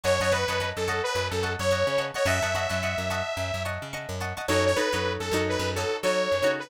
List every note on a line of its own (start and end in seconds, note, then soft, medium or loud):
0.03 0.19 F#2 medium
0.03 0.20 C#5 medium
0.03 0.16 D#5 medium
0.03 0.16 F#5 medium
0.03 0.16 A5 medium
0.03 0.16 C#6 loud
0.20 0.45 F#2 medium
0.20 0.32 C#5 medium
0.20 0.30 D#5 medium
0.20 0.30 F#5 medium
0.20 0.30 A5 medium
0.20 0.30 C#6 medium
0.31 0.70 B4 medium
0.31 0.45 D#5 medium
0.31 0.45 F#5 medium
0.31 0.45 A5 medium
0.31 0.45 C#6 medium
0.48 0.72 F#2 medium
0.48 0.58 D#5 medium
0.48 0.58 F#5 medium
0.48 0.58 A5 medium
0.48 0.58 C#6 medium
0.60 0.87 D#5 medium
0.60 0.87 F#5 medium
0.60 0.87 A5 medium
0.60 0.87 C#6 medium
0.76 1.01 F#2 medium
0.76 1.02 A4 medium
0.88 1.39 D#5 loud
0.88 1.39 F#5 medium
0.88 1.39 A5 medium
0.88 1.39 C#6 loud
1.03 1.28 B4 medium
1.15 1.30 F#2 loud
1.30 1.56 F#2 medium
1.30 1.53 A4 medium
1.43 1.66 D#5 medium
1.43 1.66 F#5 medium
1.43 1.66 A5 medium
1.43 1.66 C#6 medium
1.59 1.84 F#2 medium
1.59 2.05 C#5 medium
1.71 1.94 D#5 medium
1.71 1.94 F#5 medium
1.71 1.94 A5 medium
1.71 1.94 C#6 medium
1.87 2.11 C#3 medium
1.98 2.11 D#5 medium
1.98 2.11 F#5 medium
1.98 2.11 A5 medium
1.98 2.11 C#6 medium
2.14 2.26 C#5 medium
2.14 2.23 D#5 medium
2.14 2.23 F#5 medium
2.14 2.23 A5 medium
2.14 2.23 C#6 medium
2.25 2.40 F#2 loud
2.25 2.39 D#5 loud
2.25 3.63 E5 medium
2.25 2.39 F#5 medium
2.25 2.39 A5 medium
2.25 2.39 C#6 medium
2.42 2.67 F#2 medium
2.42 2.51 D#5 medium
2.42 2.51 F#5 medium
2.42 2.51 A5 medium
2.42 2.51 C#6 medium
2.55 2.68 D#5 medium
2.55 2.68 F#5 medium
2.55 2.68 A5 medium
2.55 2.68 C#6 medium
2.69 2.95 F#2 medium
2.69 2.79 D#5 medium
2.69 2.79 F#5 medium
2.69 2.79 A5 medium
2.69 2.79 C#6 medium
2.83 3.09 D#5 medium
2.83 3.09 F#5 medium
2.83 3.09 A5 medium
2.83 3.09 C#6 medium
2.98 3.22 F#2 medium
3.10 3.61 D#5 loud
3.10 3.61 F#5 medium
3.10 3.61 A5 medium
3.10 3.61 C#6 medium
3.37 3.51 F#2 medium
3.54 3.78 F#2 medium
3.65 3.88 D#5 medium
3.65 3.88 F#5 medium
3.65 3.88 A5 medium
3.65 3.88 C#6 medium
3.82 4.07 C#3 medium
3.93 4.16 D#5 medium
3.93 4.16 F#5 medium
3.93 4.16 A5 medium
3.93 4.16 C#6 medium
4.09 4.33 F#2 medium
4.20 4.34 D#5 medium
4.20 4.34 F#5 medium
4.20 4.34 A5 medium
4.20 4.34 C#6 medium
4.37 4.46 D#5 medium
4.37 4.46 F#5 medium
4.37 4.46 A5 medium
4.37 4.46 C#6 medium
4.48 4.74 F#2 loud
4.48 4.71 D#4 loud
4.48 4.71 F#4 medium
4.48 4.71 A4 medium
4.48 4.71 C#5 loud
4.48 4.64 C#5 medium
4.66 4.77 C#5 medium
4.76 4.89 D#4 medium
4.76 4.89 F#4 medium
4.76 4.89 A4 medium
4.76 5.13 B4 medium
4.76 4.89 C#5 medium
4.92 5.18 F#2 medium
4.92 5.30 D#4 medium
4.92 5.30 F#4 medium
4.92 5.30 A4 medium
4.92 5.30 C#5 medium
5.20 5.30 F#2 medium
5.20 5.42 A4 medium
5.31 5.57 F#2 medium
5.31 5.73 D#4 loud
5.31 5.73 F#4 medium
5.31 5.73 A4 medium
5.31 5.73 C#5 medium
5.49 5.70 B4 medium
5.59 5.85 F#2 loud
5.75 5.98 D#4 medium
5.75 5.98 F#4 medium
5.75 5.97 A4 medium
5.75 5.98 A4 medium
5.75 5.98 C#5 medium
6.03 6.28 F#3 medium
6.03 6.35 D#4 medium
6.03 6.35 F#4 medium
6.03 6.35 A4 medium
6.03 6.35 C#5 medium
6.03 6.52 C#5 medium
6.32 6.42 F#2 medium
6.42 6.68 C#3 medium
6.42 6.66 D#4 medium
6.42 6.66 F#4 medium
6.42 6.66 A4 medium
6.42 6.66 C#5 medium
6.59 6.70 B4 medium